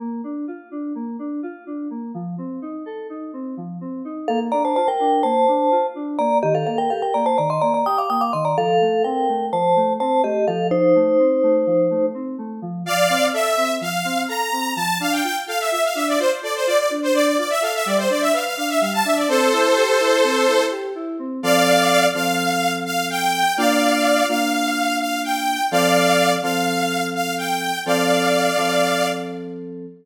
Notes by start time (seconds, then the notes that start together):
0.00 A#3
0.24 D4
0.48 F4
0.71 D4
0.95 A#3
1.19 D4
1.43 F4
1.67 D4
1.90 A#3
2.14 F3
2.38 C4
2.62 D#4
2.86 A4
3.10 D#4
3.33 C4
3.57 F3
3.81 C4
4.05 D#4
4.28 A#3 A4 F5
4.52 D4 D5 A#5
4.65 C5 A5
4.76 F4 C5 A5
4.88 A#4 G5
5.00 D4
5.23 A#3 C5 A5
5.48 D4
5.71 F4
5.95 D4
6.19 A#3 D5 A#5
6.43 D#3 G4 D#5
6.55 A4 F5
6.67 A#3 A4 F5
6.78 A#4 G5
6.90 G4 A4 F5
7.02 A#4 G5
7.14 A#3 D5 A#5
7.26 C5 A5
7.38 D#3 D5 A#5
7.50 D#5 C6
7.61 A#3 D5 A#5
7.74 D5 A#5
7.86 G4 G5 D#6
7.98 F5 D6
8.10 A#3 G5 D#6
8.21 F5 D6
8.33 D#3 D#5 C6
8.45 D5 A#5
8.57 F3 A4 F5
8.81 A3
9.04 C4 A#4 G5
9.29 A3
9.52 F3 C5 A5
9.76 A3
10.00 C4 C5 A5
10.24 A3 G4 D#5
10.48 F3 A4 F5
10.71 D#4 C5
10.95 A3
11.19 C4
11.43 A3
11.67 F3
11.90 A3
12.14 C4
12.38 A3
12.62 F3
12.86 F3 D5 F5
13.10 C4
13.33 A4 E5
13.57 C4
13.81 F3 F5
14.05 C4
14.28 A4 A#5
14.52 C4
14.76 F3 A5
15.00 D4 F5
15.12 G5
15.24 F4 G5
15.47 A4 F5
15.60 E5
15.71 F4 E5
15.84 F5
15.95 D4 E5
16.08 D5
16.19 F4 C5
16.43 A4 D5
16.55 C5
16.66 F4 D5
16.78 D5
16.90 D4
17.03 C5
17.14 D4 D5
17.26 D5
17.38 F4 D5
17.50 E5
17.62 A4 F5
17.74 E5
17.86 G3 D5
17.98 C5
18.10 D4 D5
18.21 E5
18.33 B4 F5
18.45 F5
18.57 D4 F5
18.69 E5
18.80 G3 F5
18.93 A5
19.05 D4 E5
19.16 D5
19.28 C4 A4 C5
19.52 E4
19.76 G4
20.00 E4
20.24 C4
20.48 E4
20.71 G4
20.95 E4
21.19 C4
21.43 F3 C4 A4 D5 F5
22.14 F3 C4 A4 F5
22.85 F5
23.10 G5
23.57 A#3 D4 F4 D5 F5
24.29 A#3 D4 F4 F5
25.00 F5
25.24 G5
25.71 F3 C4 A4 D5 F5
26.43 F3 C4 A4 F5
27.15 F5
27.38 G5
27.86 F3 C4 A4 D5 F5
28.57 F3 C4 A4